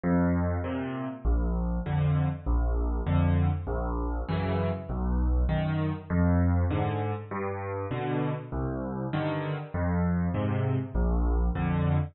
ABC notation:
X:1
M:4/4
L:1/8
Q:1/4=99
K:Eb
V:1 name="Acoustic Grand Piano" clef=bass
F,,2 [B,,C,]2 B,,,2 [F,,D,]2 | B,,,2 [F,,D,]2 B,,,2 [_G,,_D,_F,]2 | _C,,2 [_G,,E,]2 F,,2 [A,,D,]2 | G,,2 [=B,,D,]2 C,,2 [G,,D,E,]2 |
F,,2 [A,,C,]2 B,,,2 [F,,D,]2 |]